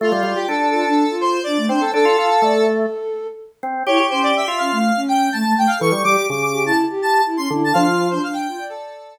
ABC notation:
X:1
M:4/4
L:1/16
Q:1/4=124
K:Ddor
V:1 name="Lead 1 (square)"
F2 F G A2 A4 c2 d2 c A | A6 z10 | ^c2 =c d e2 f4 g2 a2 g f | ^c'2 d'2 d' d'2 a z2 a2 z =c' z a |
f3 c f g3 A4 z4 |]
V:2 name="Flute"
A z F2 z2 F D2 F3 D A, D z | A2 f2 d A7 z4 | E z ^C2 z2 C A,2 C3 A, A, A, z | A z G2 z2 G E2 G3 E ^C E z |
D F2 D D2 F d5 z4 |]
V:3 name="Drawbar Organ"
A, G, G, z D4 z6 C2 | D F F z A,4 z6 C2 | G G4 F3 z8 | E, G, G, z ^C,4 z6 D,2 |
F,4 z12 |]